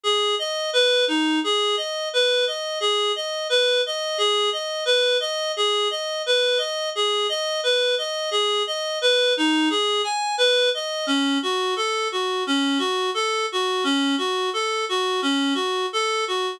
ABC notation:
X:1
M:4/4
L:1/8
Q:1/4=87
K:G#phr
V:1 name="Clarinet"
G d B D G d B d | G d B d G d B d | G d B d G d B d | G d B D G g B d |
[K:F#phr] C F A F C F A F | C F A F C F A F |]